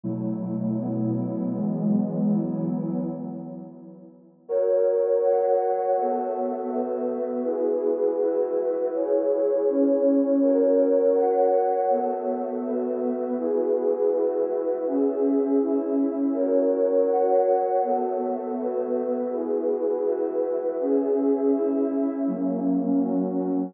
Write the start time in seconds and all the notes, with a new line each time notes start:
0.03 B2 F#3 A3 E4
0.78 B2 F#3 B3 E4
1.52 E3 F#3 G#3 B3
2.26 E3 F#3 B3 E4
4.49 F#4 A#4 C#5
5.23 F#4 C#5 F#5
5.96 B3 F#4 A4 E5
6.71 B3 F#4 B4 E5
7.44 E4 F#4 G#4 B4
8.18 E4 F#4 B4 E5
8.93 E4 G#4 C#5
9.67 C#4 E4 C#5
10.41 F#4 A#4 C#5
11.15 F#4 C#5 F#5
11.90 B3 F#4 A4 E5
12.64 B3 F#4 B4 E5
13.37 E4 F#4 G#4 B4
14.11 E4 F#4 B4 E5
14.86 C#4 G#4 E5
15.59 C#4 E4 E5
16.33 F#4 A#4 C#5
17.08 F#4 C#5 F#5
17.82 B3 F#4 A4 E5
18.57 B3 F#4 B4 E5
19.30 E4 F#4 G#4 B4
20.04 E4 F#4 B4 E5
20.78 C#4 G#4 E5
21.52 C#4 E4 E5
22.27 F#3 A#3 C#4
23.00 F#3 C#4 F#4